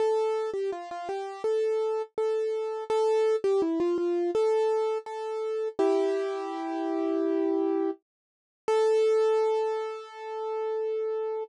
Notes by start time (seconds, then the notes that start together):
0.00 A4
0.54 G4
0.72 F4
0.91 F4
1.09 G4
1.44 A4
2.18 A4
2.90 A4
3.44 G4
3.62 E4
3.80 F4
3.98 F4
4.35 A4
5.06 A4
5.79 E4 G4
8.68 A4